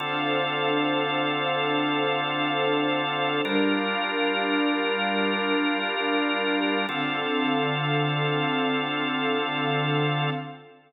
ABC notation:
X:1
M:5/4
L:1/8
Q:1/4=87
K:Dm
V:1 name="Drawbar Organ"
[D,CFA]10 | [G,DFB]10 | [D,CFA]10 |]
V:2 name="String Ensemble 1"
[DAcf]10 | [G,DBf]10 | [D,CAf]10 |]